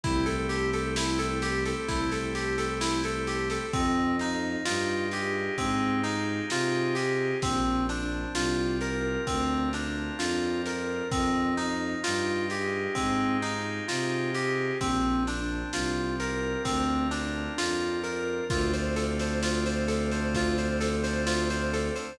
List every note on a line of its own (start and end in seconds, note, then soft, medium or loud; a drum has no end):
0.03 1.73 C2 medium
0.03 3.66 A3 medium
0.03 3.66 C4 medium
0.03 0.25 E4 medium
0.03 3.66 E4 medium
0.03 3.66 G4 medium
0.03 kick loud
0.03 snare medium
0.26 0.47 A4 medium
0.26 snare medium
0.49 0.70 G4 medium
0.49 snare medium
0.73 0.95 A4 medium
0.73 snare medium
0.96 1.18 E4 medium
0.96 snare loud
1.19 1.40 A4 medium
1.19 snare medium
1.42 1.64 G4 medium
1.42 snare loud
1.65 1.87 A4 medium
1.65 snare medium
1.88 3.59 C2 medium
1.88 2.10 E4 medium
1.88 kick loud
1.88 snare loud
2.12 2.33 A4 medium
2.12 snare medium
2.35 2.56 G4 medium
2.35 snare medium
2.58 2.79 A4 medium
2.58 snare medium
2.81 3.02 E4 medium
2.81 snare loud
3.04 3.26 A4 medium
3.04 snare medium
3.27 3.49 G4 medium
3.27 snare medium
3.50 3.72 A4 medium
3.50 snare medium
3.73 4.57 F2 medium
3.73 4.16 C4 medium
3.73 5.57 D#4 medium
3.73 kick loud
3.73 snare medium
4.19 4.63 D#4 medium
4.19 6.04 F4 medium
4.19 snare medium
4.65 5.49 G2 medium
4.65 5.08 F4 medium
4.65 6.49 G4 medium
4.65 snare loud
5.11 5.55 G4 medium
5.11 6.96 G#4 medium
5.11 snare medium
5.58 6.41 G#2 medium
5.58 6.01 C4 medium
5.58 7.33 D#4 medium
5.58 kick loud
5.58 snare medium
6.03 6.46 D#4 medium
6.03 7.36 F4 medium
6.03 snare medium
6.50 7.33 C3 medium
6.50 6.94 F4 medium
6.50 7.38 G4 medium
6.50 snare loud
6.95 7.38 G4 medium
6.95 7.40 G#4 medium
6.95 snare medium
7.42 8.26 A#1 medium
7.42 9.26 C4 medium
7.42 7.85 C4 medium
7.42 kick loud
7.42 snare loud
7.89 9.72 D4 medium
7.89 8.32 D4 medium
7.89 snare medium
8.34 9.17 C2 medium
8.34 10.19 F4 medium
8.34 8.78 F4 medium
8.34 snare loud
8.81 10.65 A#4 medium
8.81 9.24 A#4 medium
8.81 snare medium
9.27 10.10 D2 medium
9.27 9.69 C4 medium
9.27 11.02 C4 medium
9.27 kick loud
9.27 snare medium
9.73 11.04 D4 medium
9.73 10.16 D4 medium
9.73 snare medium
10.19 11.02 F2 medium
10.19 10.61 F4 medium
10.19 11.07 F4 medium
10.19 snare loud
10.65 11.09 A#4 medium
10.65 snare medium
11.11 11.95 F2 medium
11.11 11.54 C4 medium
11.11 12.96 D#4 medium
11.11 kick loud
11.11 snare medium
11.57 12.00 D#4 medium
11.57 13.42 F4 medium
11.57 snare medium
12.04 12.87 G2 medium
12.04 12.46 F4 medium
12.04 13.88 G4 medium
12.04 snare loud
12.50 12.93 G4 medium
12.50 14.34 G#4 medium
12.50 snare medium
12.95 13.80 G#2 medium
12.95 13.37 C4 medium
12.95 14.72 D#4 medium
12.95 kick medium
12.95 snare medium
13.42 13.85 D#4 medium
13.42 14.74 F4 medium
13.42 snare medium
13.88 14.71 C3 medium
13.88 14.31 F4 medium
13.88 14.76 G4 medium
13.88 snare loud
14.35 14.77 G4 medium
14.35 14.79 G#4 medium
14.35 snare medium
14.81 15.64 A#1 medium
14.81 16.65 C4 medium
14.81 15.23 C4 medium
14.81 kick loud
14.81 snare loud
15.27 17.12 D4 medium
15.27 15.70 D4 medium
15.27 snare medium
15.73 16.56 C2 medium
15.73 17.58 F4 medium
15.73 16.16 F4 medium
15.73 snare loud
16.20 18.03 A#4 medium
16.20 16.62 A#4 medium
16.20 snare medium
16.65 17.49 D2 medium
16.65 17.07 C4 medium
16.65 18.41 C4 medium
16.65 kick loud
16.65 snare loud
17.11 17.53 D4 medium
17.11 18.43 D4 medium
17.11 snare medium
17.58 18.41 F2 medium
17.58 18.00 F4 medium
17.58 18.46 F4 medium
17.58 snare loud
18.03 18.46 A#4 medium
18.03 18.48 A#4 medium
18.03 snare medium
18.50 21.90 D2 loud
18.50 22.12 A3 medium
18.50 22.12 C4 medium
18.50 22.12 D4 medium
18.50 22.12 F4 medium
18.50 18.72 F4 medium
18.50 kick loud
18.50 snare loud
18.74 18.95 C5 medium
18.74 snare medium
18.96 19.18 A4 medium
18.96 snare medium
19.19 19.42 C5 medium
19.19 snare loud
19.43 19.64 F4 medium
19.43 snare loud
19.66 19.88 C5 medium
19.66 snare medium
19.88 20.09 A4 medium
19.88 snare medium
20.12 20.33 C5 medium
20.12 snare medium
20.34 20.57 F4 medium
20.34 kick loud
20.34 snare loud
20.58 20.80 C5 medium
20.58 snare medium
20.80 21.02 A4 medium
20.80 snare loud
21.04 21.25 C5 medium
21.04 snare medium
21.27 21.48 F4 medium
21.27 snare loud
21.50 21.72 C5 medium
21.50 snare medium
21.73 21.95 A4 medium
21.73 snare medium
21.96 22.17 C5 medium
21.96 snare medium